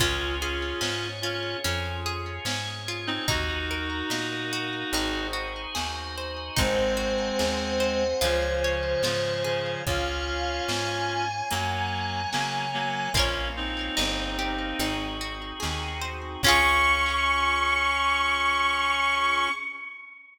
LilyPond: <<
  \new Staff \with { instrumentName = "Violin" } { \time 4/4 \key des \major \tempo 4 = 73 r1 | r1 | c''1 | f''4 aes''2. |
r1 | des'''1 | }
  \new Staff \with { instrumentName = "Clarinet" } { \time 4/4 \key des \major <des' f'>8 <des' f'>4 <des' f'>8 r4. r16 <c' ees'>16 | <ees' ges'>2~ <ees' ges'>8 r4. | <aes c'>2 <des f>4 <des f>8 <des f>8 | <des' f'>2 <ges bes>4 <ges bes>8 <ges bes>8 |
<bes des'>8 <c' ees'>2 r4. | des'1 | }
  \new Staff \with { instrumentName = "Orchestral Harp" } { \time 4/4 \key des \major des'8 aes'8 des'8 f'8 des'8 aes'8 des'8 f'8 | ees'8 bes'8 ees'8 ges'8 ees'8 ges'8 aes'8 c''8 | ees'8 ges'8 aes'8 c''8 f'8 des''8 f'8 aes'8 | r1 |
<f' bes' des''>4 ees'8 g'8 ees'8 ges'8 aes'8 c''8 | <des' f' aes'>1 | }
  \new Staff \with { instrumentName = "Electric Bass (finger)" } { \clef bass \time 4/4 \key des \major des,4 aes,4 f,4 aes,4 | ees,4 bes,4 aes,,4 ees,4 | aes,,4 ees,4 des,4 aes,4 | des,4 aes,4 ges,4 des4 |
bes,,4 g,,4 aes,,4 ees,4 | des,1 | }
  \new Staff \with { instrumentName = "Drawbar Organ" } { \time 4/4 \key des \major <des' f' aes'>4 <des' aes' des''>4 <des' f' aes'>4 <des' aes' des''>4 | <ees' ges' bes'>4 <bes ees' bes'>4 <ees' ges' aes' c''>4 <ees' ges' c'' ees''>4 | <c'' ees'' ges'' aes''>2 <des'' f'' aes''>2 | <des'' f'' aes''>2 <des'' ges'' bes''>2 |
<bes des' f'>4 <bes ees' g'>4 <c' ees' ges' aes'>2 | <des' f' aes'>1 | }
  \new DrumStaff \with { instrumentName = "Drums" } \drummode { \time 4/4 <hh bd>4 sn4 hh4 sn4 | <hh bd>4 sn4 hh4 sn4 | <hh bd>4 sn4 hh4 sn4 | <hh bd>4 sn4 hh4 sn4 |
<hh bd>4 sn4 hh4 sn4 | <cymc bd>4 r4 r4 r4 | }
>>